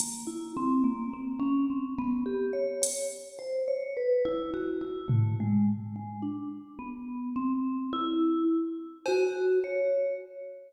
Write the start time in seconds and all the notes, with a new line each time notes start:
0.00 A#3, closed hi-hat
0.27 E4
0.57 C4
0.84 A#3
1.13 C4
1.40 C#4
1.70 C4
1.98 B3
2.26 G4
2.53 C#5
2.82 C#5, closed hi-hat
3.39 C5
3.68 C#5
3.97 B4
4.25 E4
4.54 F#4
4.81 E4
5.08 A3, floor tom
5.40 G#3
5.96 G#3
6.22 D4
6.79 B3
7.36 C4
7.93 E4
9.06 F#4, cowbell
9.64 C#5